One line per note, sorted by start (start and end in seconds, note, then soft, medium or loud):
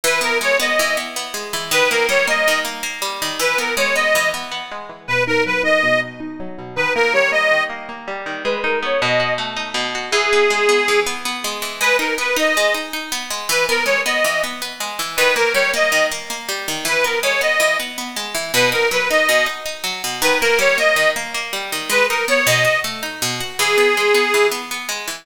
0.04 0.79 E3 loud
0.04 0.20 B4 loud
0.21 0.59 B3 medium
0.21 0.38 A#4 loud
0.41 1.33 G#3 medium
0.41 0.57 C#5 loud
0.60 0.97 B3 medium
0.60 0.96 D#5 medium
0.79 1.53 E3 medium
0.97 1.16 B3 medium
1.16 1.70 B3 medium
1.34 1.69 G#3 medium
1.53 1.71 E3 medium
1.71 2.47 D#3 loud
1.71 1.90 B4 loud
1.90 2.27 A#3 medium
1.90 2.07 A#4 loud
2.09 3.01 G3 medium
2.09 2.26 C#5 loud
2.27 2.64 A#3 medium
2.27 2.59 D#5 loud
2.48 3.21 D#3 medium
2.65 2.82 A#3 medium
2.83 3.36 A#3 medium
3.02 3.37 G3 medium
3.22 3.40 D#3 medium
3.39 4.15 E3 medium
3.39 3.58 B4 loud
3.58 3.95 B3 medium
3.58 3.74 A#4 medium
3.77 4.71 G#3 medium
3.77 3.95 C#5 loud
3.95 4.33 B3 medium
3.95 4.29 D#5 loud
4.15 4.89 E3 medium
4.34 4.51 B3 medium
4.52 5.05 B3 medium
4.71 5.07 G#3 medium
4.89 5.07 E3 medium
5.08 5.83 B2 loud
5.08 5.24 B4 loud
5.27 5.63 D#4 medium
5.27 5.44 A#4 loud
5.46 6.39 F#3 medium
5.46 5.62 B4 loud
5.63 6.01 D#4 medium
5.63 6.00 D#5 loud
5.83 6.58 B2 medium
6.02 6.20 D#4 medium
6.20 6.73 D#4 medium
6.40 6.75 F#3 medium
6.58 6.76 B2 medium
6.76 7.51 D#3 loud
6.76 6.93 B4 loud
6.95 7.31 A#3 medium
6.95 7.13 A#4 loud
7.13 8.07 G3 medium
7.13 7.31 C#5 loud
7.32 7.69 A#3 medium
7.32 7.63 D#5 loud
7.51 8.26 D#3 medium
7.70 7.88 A#3 medium
7.89 8.42 A#3 medium
8.08 8.43 G3 medium
8.26 8.44 D#3 medium
8.44 8.98 G#3 loud
8.44 8.60 B4 loud
8.63 8.99 D#4 medium
8.63 8.79 A#4 medium
8.83 9.00 B3 medium
8.83 9.01 C#5 loud
9.01 9.74 B2 loud
9.01 9.34 D#5 loud
9.20 9.94 F#4 medium
9.38 10.09 A3 medium
9.57 10.10 D#4 medium
9.74 10.10 B2 medium
9.95 10.13 F#4 medium
10.11 10.88 E3 loud
10.11 11.00 G#4 loud
10.33 10.68 B3 medium
10.50 11.44 G#3 medium
10.69 11.06 B3 medium
10.88 11.62 E3 medium
11.06 11.25 B3 medium
11.25 11.79 B3 medium
11.44 11.80 G#3 medium
11.62 11.80 E3 medium
11.81 11.99 G#3 medium
11.81 11.96 B4 loud
11.99 12.18 D#4 medium
11.99 12.15 A#4 medium
12.18 12.37 B3 medium
12.18 12.36 B4 loud
12.36 12.55 D#4 medium
12.36 12.74 D#5 loud
12.57 12.76 G#3 medium
12.74 12.93 D#4 medium
12.93 13.12 D#4 medium
13.12 13.31 B3 medium
13.30 13.48 G#3 medium
13.49 13.68 E3 loud
13.49 13.66 B4 loud
13.69 13.88 B3 medium
13.69 13.84 A#4 loud
13.86 14.04 G#3 medium
13.86 14.01 C#5 loud
14.06 14.24 B3 medium
14.06 14.42 D#5 medium
14.24 14.43 E3 medium
14.44 14.61 B3 medium
14.62 14.80 B3 medium
14.80 14.99 G#3 medium
14.99 15.17 E3 medium
15.16 15.37 D#3 loud
15.16 15.34 B4 loud
15.36 15.55 A#3 medium
15.36 15.53 A#4 loud
15.54 15.73 G3 medium
15.54 15.71 C#5 loud
15.74 15.92 A#3 medium
15.74 16.06 D#5 loud
15.92 16.11 D#3 medium
16.11 16.29 A#3 medium
16.30 16.49 A#3 medium
16.49 16.67 G3 medium
16.68 16.86 D#3 medium
16.85 17.04 E3 medium
16.85 17.05 B4 loud
17.04 17.23 B3 medium
17.04 17.19 A#4 medium
17.23 17.42 G#3 medium
17.23 17.41 C#5 loud
17.41 17.60 B3 medium
17.41 17.77 D#5 loud
17.60 17.79 E3 medium
17.80 17.97 B3 medium
17.98 18.17 B3 medium
18.16 18.35 G#3 medium
18.35 18.52 E3 medium
18.54 18.73 B2 loud
18.54 18.70 B4 loud
18.72 18.91 D#4 medium
18.72 18.89 A#4 loud
18.91 19.10 F#3 medium
18.91 19.09 B4 loud
19.10 19.29 D#4 medium
19.10 19.46 D#5 loud
19.29 19.47 B2 medium
19.46 19.65 D#4 medium
19.66 19.84 D#4 medium
19.84 20.02 F#3 medium
20.04 20.22 B2 medium
20.21 20.40 D#3 loud
20.21 20.39 B4 loud
20.40 20.61 A#3 medium
20.40 20.58 A#4 loud
20.59 20.77 G3 medium
20.59 20.77 C#5 loud
20.78 20.96 A#3 medium
20.78 21.10 D#5 loud
20.96 21.15 D#3 medium
21.16 21.34 A#3 medium
21.34 21.53 A#3 medium
21.53 21.72 G3 medium
21.72 21.90 D#3 medium
21.90 22.08 G#3 loud
21.90 22.06 B4 loud
22.09 22.29 D#4 medium
22.09 22.25 A#4 medium
22.28 22.46 B3 medium
22.28 22.46 C#5 loud
22.47 22.65 B2 loud
22.47 22.79 D#5 loud
22.65 22.83 F#4 medium
22.84 23.03 A3 medium
23.03 23.21 D#4 medium
23.22 23.41 B2 medium
23.40 23.58 F#4 medium
23.59 23.78 E3 loud
23.59 24.47 G#4 loud
23.78 23.96 B3 medium
23.97 24.16 G#3 medium
24.14 24.33 B3 medium
24.34 24.53 E3 medium
24.51 24.70 B3 medium
24.71 24.90 B3 medium
24.89 25.07 G#3 medium
25.08 25.25 E3 medium